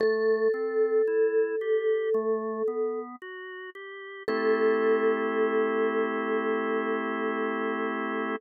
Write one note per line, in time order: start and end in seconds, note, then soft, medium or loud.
0.00 0.48 A3 loud
0.00 2.99 A4 loud
0.54 1.02 C4 medium
1.07 1.56 E4 medium
1.61 2.09 G4 medium
2.14 2.63 A3 loud
2.68 3.16 B3 medium
3.22 3.70 F#4 medium
3.75 4.23 G4 medium
4.28 8.36 A3 loud
4.28 8.36 C4 loud
4.28 8.36 E4 loud
4.28 8.36 G4 loud
4.28 8.35 A4 loud